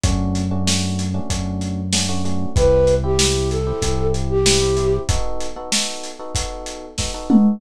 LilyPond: <<
  \new Staff \with { instrumentName = "Flute" } { \time 4/4 \key e \minor \tempo 4 = 95 r1 | b'8. g'8. a'4 r16 g'4~ g'16 | r1 | }
  \new Staff \with { instrumentName = "Electric Piano 1" } { \time 4/4 \key e \minor <a cis' d' fis'>8. <a cis' d' fis'>16 <a cis' d' fis'>8. <a cis' d' fis'>16 <a cis' d' fis'>4 <a cis' d' fis'>16 <a cis' d' fis'>16 <a cis' d' fis'>8 | <c' e' g'>8. <c' e' g'>16 <c' e' g'>8. <c' e' g'>16 <c' e' g'>4 <c' e' g'>16 <c' e' g'>16 <c' e' g'>8 | <b dis' fis' a'>8. <b dis' fis' a'>16 <b dis' fis' a'>8. <b dis' fis' a'>16 <b dis' fis' a'>4 <b dis' fis' a'>16 <b dis' fis' a'>16 <b dis' fis' a'>8 | }
  \new Staff \with { instrumentName = "Synth Bass 1" } { \clef bass \time 4/4 \key e \minor fis,2 fis,2 | c,2 c,2 | r1 | }
  \new DrumStaff \with { instrumentName = "Drums" } \drummode { \time 4/4 <hh bd>8 hh8 sn8 hh8 <hh bd>8 hh8 sn8 hh8 | <hh bd>8 hh8 sn8 hh8 <hh bd>8 hh8 sn8 hh8 | <hh bd>8 hh8 sn8 hh8 <hh bd>8 hh8 <bd sn>8 toml8 | }
>>